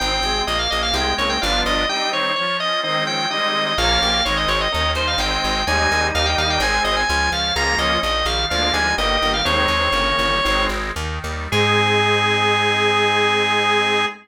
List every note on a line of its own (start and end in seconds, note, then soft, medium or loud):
0.00 0.21 G#1 medium
0.00 0.19 D#3 medium
0.00 0.45 C4 loud
0.00 0.19 C4 medium
0.00 0.42 G5 loud
0.22 0.42 G#1 medium
0.22 0.46 C3 medium
0.22 0.46 G#3 medium
0.22 0.46 G#4 medium
0.47 0.68 A#1 medium
0.47 0.92 A#3 loud
0.47 0.58 D#5 medium
0.59 0.70 F5 medium
0.70 0.92 A#1 medium
0.70 0.93 C#4 medium
0.70 0.82 D#5 medium
0.83 0.94 F5 medium
0.94 1.14 C2 medium
0.94 1.15 C3 medium
0.94 1.15 G#3 medium
0.94 1.39 G#3 loud
0.94 1.15 G5 medium
1.18 1.38 C2 medium
1.18 1.37 C#3 medium
1.18 1.37 A#3 medium
1.18 1.41 C4 medium
1.18 1.29 C#5 medium
1.29 1.41 G5 medium
1.41 1.63 G1 loud
1.41 1.85 F3 medium
1.41 1.84 G3 medium
1.41 1.84 B3 loud
1.41 1.85 D4 medium
1.41 1.84 D4 medium
1.41 1.84 F4 medium
1.41 1.61 F5 medium
1.66 1.86 G1 medium
1.66 1.89 D#5 medium
1.89 2.12 G3 medium
1.89 2.32 G3 loud
1.89 2.32 C4 medium
1.89 2.12 D#4 medium
1.89 2.32 D#4 medium
1.89 2.10 G5 medium
2.12 2.35 D#3 medium
2.12 2.35 C4 medium
2.12 2.35 C#5 medium
2.36 2.81 F3 loud
2.36 2.57 C#5 medium
2.60 2.82 C#4 medium
2.60 2.80 D#5 medium
2.83 3.03 D#3 medium
2.83 3.26 D#3 loud
2.83 3.26 G#3 medium
2.83 3.03 C4 medium
2.83 3.26 C4 loud
2.83 3.04 D#5 medium
3.07 3.26 F3 medium
3.07 3.26 C#4 medium
3.07 3.29 G5 medium
3.30 3.73 D#3 loud
3.30 3.71 G3 medium
3.30 3.73 G#3 loud
3.30 3.73 C4 loud
3.30 3.71 D#4 medium
3.30 3.64 D#5 medium
3.66 3.78 D#5 medium
3.78 3.98 A#1 medium
3.78 4.20 F3 loud
3.78 4.20 A#3 loud
3.78 4.00 C#4 medium
3.78 4.20 C#4 medium
3.78 4.00 A#4 medium
3.78 4.23 F5 loud
4.02 4.22 A#1 medium
4.02 4.21 A#3 medium
4.02 4.21 G4 medium
4.25 4.46 G#1 medium
4.25 4.68 D#3 loud
4.25 4.68 G#3 loud
4.25 4.68 C4 medium
4.25 4.36 C#5 medium
4.37 4.48 D#5 medium
4.48 4.68 G#1 medium
4.48 4.60 C#5 medium
4.61 4.72 D#5 medium
4.72 4.94 D#2 medium
4.72 5.17 D#3 loud
4.72 4.91 C#4 medium
4.72 4.91 A#4 medium
4.72 4.92 D#5 medium
4.95 5.15 D#2 medium
4.95 5.18 G3 medium
4.95 5.15 D#4 medium
4.95 5.15 C5 medium
4.95 5.07 C5 medium
5.07 5.19 F5 medium
5.18 5.38 G#1 medium
5.18 5.62 D#3 medium
5.18 5.62 G#3 medium
5.18 5.62 C4 loud
5.18 5.60 D#4 medium
5.18 5.60 C5 medium
5.18 5.64 G5 medium
5.44 5.64 G#1 medium
5.67 5.88 D#2 medium
5.67 6.09 D#3 loud
5.67 6.59 G3 medium
5.67 6.09 G#3 loud
5.67 6.09 C4 medium
5.67 6.59 D#4 loud
5.67 6.07 G#5 medium
5.92 6.12 D#2 medium
6.14 6.35 D#2 medium
6.14 6.59 D#3 loud
6.14 6.26 F5 medium
6.26 6.37 G5 medium
6.38 6.58 D#2 medium
6.38 6.60 G3 medium
6.38 6.49 F5 medium
6.50 6.61 G5 medium
6.60 6.80 G#1 loud
6.60 7.04 D#3 loud
6.60 7.04 G#3 loud
6.60 7.00 C4 medium
6.60 7.04 C4 loud
6.60 7.00 G#4 medium
6.60 6.83 G#5 medium
6.84 7.05 G#1 medium
6.84 6.96 D#5 medium
6.96 7.08 G#5 medium
7.08 7.30 C#2 loud
7.08 7.53 F3 loud
7.08 7.31 G#5 medium
7.32 7.52 C#2 medium
7.32 7.55 C#4 medium
7.32 7.54 F5 medium
7.56 7.76 C#2 medium
7.56 7.99 F3 loud
7.56 7.75 G#3 medium
7.56 7.99 A#3 loud
7.56 7.99 C#4 medium
7.56 7.75 F4 medium
7.56 7.77 A#5 medium
7.78 7.98 C#2 medium
7.78 8.03 F3 medium
7.78 8.03 C#4 medium
7.78 8.00 D#5 medium
8.03 8.23 A#1 medium
8.03 8.48 D#3 medium
8.03 8.26 D#5 medium
8.25 8.46 A#1 medium
8.25 8.49 G3 medium
8.25 8.46 F5 medium
8.50 8.71 D2 medium
8.50 8.93 D3 loud
8.50 8.93 F3 loud
8.50 8.71 F3 medium
8.50 8.93 G#3 medium
8.50 8.93 A#3 loud
8.50 8.71 D4 medium
8.50 8.73 F5 medium
8.73 8.94 D2 medium
8.73 8.96 G3 medium
8.73 8.96 D#4 medium
8.73 8.95 G#5 medium
8.98 9.18 G1 medium
8.98 9.43 D#3 loud
8.98 9.41 A#3 medium
8.98 9.41 G4 medium
8.98 9.32 D#5 medium
9.21 9.42 G1 medium
9.21 9.44 G3 medium
9.34 9.45 F5 medium
9.45 9.66 D#2 medium
9.45 9.68 D#3 medium
9.45 9.88 D#3 medium
9.45 9.88 G#3 loud
9.45 9.68 C4 medium
9.45 9.88 C4 medium
9.45 10.64 C#5 loud
9.68 9.89 D#2 medium
9.80 9.92 D#3 medium
9.80 9.92 C4 medium
9.92 10.13 G1 medium
9.92 10.36 C#3 medium
9.92 10.41 D#3 medium
9.92 10.36 A#3 medium
10.18 10.40 G1 medium
10.18 10.42 G3 medium
10.43 10.68 G#1 medium
10.43 10.69 D#3 medium
10.43 10.91 D#3 medium
10.43 10.91 G#3 loud
10.43 10.69 C4 medium
10.43 10.91 C4 loud
10.69 10.92 G#1 medium
10.96 11.19 D#2 loud
10.96 11.49 D#3 medium
11.24 11.48 D#2 medium
11.24 11.50 G3 medium
11.52 14.06 G#2 loud
11.52 14.06 G#3 loud
11.52 14.05 C4 medium
11.52 14.05 D#4 loud
11.52 14.05 G#4 loud